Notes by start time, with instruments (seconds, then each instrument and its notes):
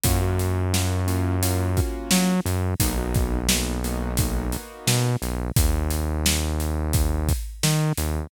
0.03 synth bass 1 F#2, acoustic grand piano A#3 C#4 F4 F#4, kick, closed hi-hat
0.21 acoustic grand piano A#3 C#4 F4 F#4
0.39 closed hi-hat
0.73 acoustic grand piano A#3 C#4 F4 F#4, snare
1.07 acoustic grand piano A#3 C#4 F4 F#4, closed hi-hat
1.43 acoustic grand piano A#3 C#4 F4 F#4, closed hi-hat
1.77 acoustic grand piano A#3 C#4 F4 F#4, kick, closed hi-hat
2.11 synth bass 1 F#3, snare
2.46 synth bass 1 F#2, closed hi-hat
2.80 synth bass 1 B1, acoustic grand piano A#3 B3 D#4 F#4, kick, closed hi-hat
2.98 acoustic grand piano A#3 B3 D#4 F#4
3.14 kick, closed hi-hat
3.49 acoustic grand piano A#3 B3 D#4 F#4, snare
3.84 acoustic grand piano A#3 B3 D#4 F#4, closed hi-hat
4.17 acoustic grand piano A#3 B3 D#4 F#4, kick, closed hi-hat
4.52 acoustic grand piano A#3 B3 D#4 F#4, closed hi-hat
4.87 synth bass 1 B2, snare
5.22 synth bass 1 B1, closed hi-hat
5.56 synth bass 1 D#2, kick, closed hi-hat
5.90 closed hi-hat
6.26 snare
6.60 closed hi-hat
6.93 kick, closed hi-hat
7.29 kick, closed hi-hat
7.63 synth bass 1 D#3, snare
7.97 synth bass 1 D#2, closed hi-hat